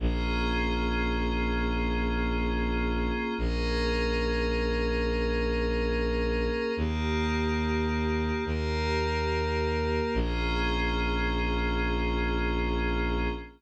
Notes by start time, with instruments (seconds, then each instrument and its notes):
0.00 violin A#1, pad 5 (bowed) A#3 C#4 F4 G#4
3.38 violin A#1, pad 5 (bowed) A#3 C#4 G#4 A#4
6.77 violin D#2, pad 5 (bowed) A#3 D#4 G4
8.45 violin D#2, pad 5 (bowed) A#3 G4 A#4
10.14 violin A#1, pad 5 (bowed) A#3 C#4 F4 G#4